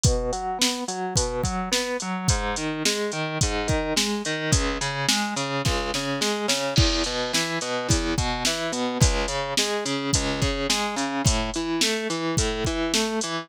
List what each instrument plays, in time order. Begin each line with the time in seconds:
0.04 overdriven guitar B2, kick, closed hi-hat
0.32 overdriven guitar F#3, closed hi-hat
0.59 overdriven guitar B3, snare
0.88 overdriven guitar F#3, closed hi-hat
1.16 overdriven guitar B2, kick, closed hi-hat
1.43 overdriven guitar F#3, kick, closed hi-hat
1.71 overdriven guitar B3, snare
2.00 overdriven guitar F#3, closed hi-hat
2.28 overdriven guitar G#2, kick, closed hi-hat
2.56 overdriven guitar D#3, closed hi-hat
2.85 overdriven guitar G#3, snare
3.12 overdriven guitar D#3, closed hi-hat
3.41 overdriven guitar G#2, kick, closed hi-hat
3.68 overdriven guitar D#3, kick, closed hi-hat
3.96 overdriven guitar G#3, snare
4.25 overdriven guitar D#3, closed hi-hat
4.52 overdriven guitar C#2, kick, closed hi-hat
4.81 overdriven guitar C#3, closed hi-hat
5.09 overdriven guitar G#3, snare
5.36 overdriven guitar C#3, closed hi-hat
5.65 overdriven guitar C#2, kick, snare
5.94 overdriven guitar C#3, snare
6.21 overdriven guitar G#3, snare
6.48 overdriven guitar C#3, snare
6.76 overdriven guitar E2, kick, crash
7.04 overdriven guitar B2, closed hi-hat
7.33 overdriven guitar E3, snare
7.61 overdriven guitar B2, closed hi-hat
7.89 overdriven guitar E2, kick, closed hi-hat
8.18 overdriven guitar B2, kick, closed hi-hat
8.45 overdriven guitar E3, snare
8.72 overdriven guitar B2, closed hi-hat
9.00 overdriven guitar C#2, kick, closed hi-hat
9.28 overdriven guitar C#3, closed hi-hat
9.57 overdriven guitar G#3, snare
9.85 overdriven guitar C#3, closed hi-hat
10.13 overdriven guitar C#2, kick, closed hi-hat
10.41 overdriven guitar C#3, kick, closed hi-hat
10.70 overdriven guitar G#3, snare
10.96 overdriven guitar C#3, closed hi-hat
11.24 overdriven guitar A2, kick, closed hi-hat
11.54 overdriven guitar E3, closed hi-hat
11.81 overdriven guitar A3, snare
12.10 overdriven guitar E3, closed hi-hat
12.37 overdriven guitar A2, kick, closed hi-hat
12.65 overdriven guitar E3, kick, closed hi-hat
12.94 overdriven guitar A3, snare
13.21 overdriven guitar E3, closed hi-hat